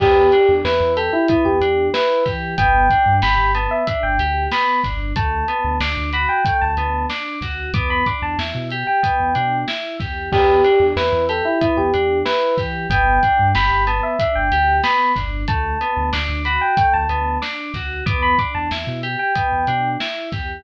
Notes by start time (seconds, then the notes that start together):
0.00 E2 B3 G4, kick, crash
0.32 D4, closed hi-hat
0.49 E2
0.65 E2 E4 B4, snare
0.81 E2
0.97 G4 A4, closed hi-hat
1.13 E4
1.28 B3 E4, kick, closed hi-hat
1.45 E2 G4
1.61 E2 D4, closed hi-hat
1.94 E4 B4, snare
2.26 E3 G4, kick, snare, closed hi-hat
2.58 G1 B3 G5, kick, closed hi-hat
2.90 D4, kick, closed hi-hat
3.06 G2
3.22 G1 G4 B5, snare
3.38 G1
3.55 B3 A5, closed hi-hat
3.71 E5
3.87 D4 E5, kick, closed hi-hat
4.03 G1 G5
4.19 D2 G4, closed hi-hat
4.51 B3 B5, snare
4.84 G1 D4, kick, snare, closed hi-hat
5.16 D2 A3 A5, kick, closed hi-hat
5.48 B3, closed hi-hat
5.64 D2
5.80 D2 D4 D6, snare
5.97 D2
6.13 F#4 B5, closed hi-hat
6.29 G5
6.45 A3 G5, kick, closed hi-hat
6.61 D2 A5
6.77 D2 B3, closed hi-hat
7.10 D4 D6, snare
7.41 D2 F#4, kick, snare, closed hi-hat
7.73 E2 B3 D6, kick, closed hi-hat
7.90 B5
8.06 D4 D6, kick, snare, closed hi-hat
8.22 E2 A5
8.38 E2 E4, snare
8.55 B2
8.70 G4, closed hi-hat
8.87 G5
9.03 B3, kick, closed hi-hat
9.20 E2
9.35 B2 D4, closed hi-hat
9.68 E4, snare
10.00 E2 G4, kick, snare, closed hi-hat
10.32 E2 B3 G4, kick, crash
10.64 D4, closed hi-hat
10.80 E2
10.96 E2 E4 B4, snare
11.13 E2
11.29 G4 A4, closed hi-hat
11.45 E4
11.61 B3 E4, kick, closed hi-hat
11.77 E2 G4
11.94 E2 D4, closed hi-hat
12.25 E4 B4, snare
12.58 E3 G4, kick, snare, closed hi-hat
12.90 G1 B3 G5, kick, closed hi-hat
13.23 D4, kick, closed hi-hat
13.39 G2
13.55 G1 G4 B5, snare
13.71 G1
13.87 B3 A5, closed hi-hat
14.03 E5
14.19 D4 E5, kick, closed hi-hat
14.35 G1 G5
14.52 D2 G4, closed hi-hat
14.83 B3 B5, snare
15.16 G1 D4, kick, snare, closed hi-hat
15.48 D2 A3 A5, kick, closed hi-hat
15.81 B3, closed hi-hat
15.97 D2
16.13 D2 D4 D6, snare
16.29 D2
16.45 F#4 B5, closed hi-hat
16.61 G5
16.77 A3 G5, kick, closed hi-hat
16.94 D2 A5
17.09 D2 B3, closed hi-hat
17.42 D4 D6, snare
17.74 D2 F#4, kick, snare, closed hi-hat
18.06 E2 B3 D6, kick, closed hi-hat
18.22 B5
18.38 D4 D6, kick, snare, closed hi-hat
18.55 E2 A5
18.71 E2 E4, snare
18.87 B2
19.03 G4, closed hi-hat
19.19 G5
19.35 B3, kick, closed hi-hat
19.52 E2
19.67 B2 D4, closed hi-hat
20.00 E4, snare
20.32 E2 G4, kick, snare, closed hi-hat